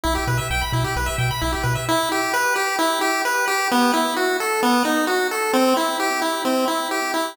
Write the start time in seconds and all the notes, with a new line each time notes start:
0.04 B1 E4
0.15 G4
0.27 B2 B4
0.38 E5
0.50 B1 G5
0.61 B5
0.73 B2 E4
0.84 G4
0.96 B1 B4
1.06 E5
1.18 B2 G5
1.31 B5
1.42 B1 E4
1.52 G4
1.63 B2 B4
1.75 E5
1.89 E4
2.12 G4
2.33 B4
2.56 G4
2.79 E4
3.01 G4
3.25 B4
3.48 G4
3.71 B3
3.94 E4
4.16 F#4
4.40 A4
4.63 B3
4.85 D#4
5.07 F#4
5.31 A4
5.53 C4
5.77 E4
6.00 G4
6.22 E4
6.45 C4
6.68 E4
6.91 G4
7.14 E4